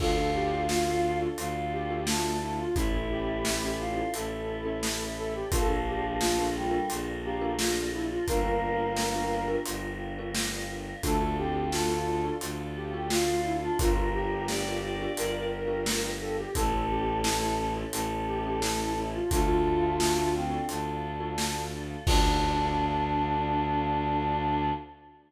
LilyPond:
<<
  \new Staff \with { instrumentName = "Flute" } { \time 4/4 \key d \minor \tempo 4 = 87 a'8 g'8 f'4 r8 g'8 f'8 e'16 f'16 | e'8 g'4. a'4. a'16 g'16 | a'8 g'8 f'4 r8 g'8 f'8 e'16 f'16 | bes'2 r2 |
a'8 g'8 f'4 r8 g'8 f'8 e'16 f'16 | f'8 g'4. bes'4. a'16 g'16 | a'8 g'8 e'4 r8 g'8 e'8 e'16 f'16 | f'2 r2 |
d'1 | }
  \new Staff \with { instrumentName = "Choir Aahs" } { \time 4/4 \key d \minor f'2 f'4 a8 a16 r16 | e'4. f'8 e'2 | f4. g16 g16 r8 bes8 r4 | bes2 r2 |
a8 c'8 a'4 r8. g'16 f'8. d'16 | bes'4 d''8 d''4 r4. | a'2 a'2 | a4. c'8 d'4. r8 |
d'1 | }
  \new Staff \with { instrumentName = "Marimba" } { \time 4/4 \key d \minor <d' f' a'>16 <d' f' a'>4 <d' f' a'>8 <d' f' a'>4 <d' f' a'>4~ <d' f' a'>16 | <cis' e' a'>16 <cis' e' a'>4 <cis' e' a'>8 <cis' e' a'>4 <cis' e' a'>4~ <cis' e' a'>16 | <d' f' a' bes'>16 <d' f' a' bes'>4 <d' f' a' bes'>8 <d' f' a' bes'>4 <d' f' a' bes'>4~ <d' f' a' bes'>16 | <d' f' g' bes'>16 <d' f' g' bes'>4 <d' f' g' bes'>8 <d' f' g' bes'>4 <d' f' g' bes'>4~ <d' f' g' bes'>16 |
<d' f' a'>16 <d' f' a'>4 <d' f' a'>8 <d' f' a'>4 <d' f' a'>4~ <d' f' a'>16 | <d' f' g' bes'>16 <d' f' g' bes'>4 <d' f' g' bes'>8 <d' f' g' bes'>4 <d' f' g' bes'>4~ <d' f' g' bes'>16 | <cis' e' a'>16 <cis' e' a'>4 <cis' e' a'>8 <cis' e' a'>4 <cis' e' a'>4~ <cis' e' a'>16 | <d' f' a'>16 <d' f' a'>4 <d' f' a'>8 <d' f' a'>4 <d' f' a'>4~ <d' f' a'>16 |
<d' f' a'>1 | }
  \new Staff \with { instrumentName = "Violin" } { \clef bass \time 4/4 \key d \minor d,2 d,2 | a,,2 a,,2 | bes,,2 bes,,2 | g,,2 g,,2 |
d,2 d,2 | g,,2 g,,2 | a,,2 a,,2 | d,2 d,2 |
d,1 | }
  \new Staff \with { instrumentName = "Choir Aahs" } { \time 4/4 \key d \minor <d' f' a'>1 | <cis' e' a'>1 | <d' f' a' bes'>1 | <d' f' g' bes'>1 |
<d' f' a'>1 | <d' f' g' bes'>1 | <cis' e' a'>1 | <d' f' a'>1 |
<d' f' a'>1 | }
  \new DrumStaff \with { instrumentName = "Drums" } \drummode { \time 4/4 <cymc bd>4 sn4 hh4 sn4 | <hh bd>4 sn4 hh4 sn4 | <hh bd>4 sn4 hh4 sn4 | <hh bd>4 sn4 hh4 sn4 |
<hh bd>4 sn4 hh4 sn4 | <hh bd>4 sn4 hh4 sn4 | <hh bd>4 sn4 hh4 sn4 | <hh bd>4 sn4 hh4 sn4 |
<cymc bd>4 r4 r4 r4 | }
>>